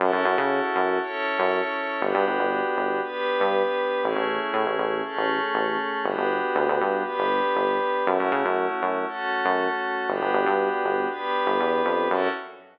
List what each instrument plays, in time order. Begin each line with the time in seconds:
0.00 synth bass 1 F#2, pad 5 (bowed) C#4 E4 F#4 A4
0.13 synth bass 1 F#2
0.25 synth bass 1 F#2
0.38 synth bass 1 C#3
0.76 synth bass 1 F#2
1.02 pad 5 (bowed) C#4 E4 A4 C#5
1.39 synth bass 1 F#2
2.00 synth bass 1 G1, pad 5 (bowed) B3 D4 F#4 G4
2.14 synth bass 1 G2
2.27 synth bass 1 G1
2.39 synth bass 1 G1
2.77 synth bass 1 G1
3.04 pad 5 (bowed) B3 D4 G4 B4
3.40 synth bass 1 G2
4.03 synth bass 1 A1, pad 5 (bowed) A3 C#4 E4 G#4
4.16 synth bass 1 A1
4.54 synth bass 1 A2
4.66 synth bass 1 A1
4.79 synth bass 1 A1
5.04 pad 5 (bowed) A3 C#4 G#4 A4
5.17 synth bass 1 A1
5.55 synth bass 1 A1
6.04 synth bass 1 G1, pad 5 (bowed) B3 D4 F#4 G4
6.18 synth bass 1 G1
6.56 synth bass 1 D2
6.68 synth bass 1 D2
6.81 synth bass 1 G2
7.04 pad 5 (bowed) B3 D4 G4 B4
7.18 synth bass 1 G1
7.56 synth bass 1 G1
8.06 synth bass 1 F#2, pad 5 (bowed) A3 C#4 E4 F#4
8.19 synth bass 1 F#2
8.32 synth bass 1 C#3
8.45 synth bass 1 F#2
8.82 synth bass 1 F#2
9.08 pad 5 (bowed) A3 C#4 F#4 A4
9.45 synth bass 1 F#2
10.08 synth bass 1 G1, pad 5 (bowed) B3 D4 F#4 G4
10.21 synth bass 1 G1
10.34 synth bass 1 G1
10.46 synth bass 1 G2
10.84 synth bass 1 G1
11.10 pad 5 (bowed) B3 D4 G4 B4
11.47 synth bass 1 G1
11.60 synth bass 1 E2
11.85 synth bass 1 F2
12.10 synth bass 1 F#2, pad 5 (bowed) C#4 E4 F#4 A4